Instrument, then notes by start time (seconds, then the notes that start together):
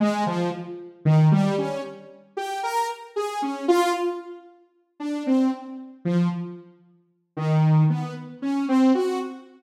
lead 2 (sawtooth)
0.00 G#3
0.26 F3
1.05 D#3
1.32 G3
1.58 C#4
2.37 G4
2.63 A#4
3.16 G#4
3.42 C#4
3.68 F4
5.00 D4
5.27 C4
6.05 F3
7.37 D#3
7.90 B3
8.42 C#4
8.68 C4
8.95 F#4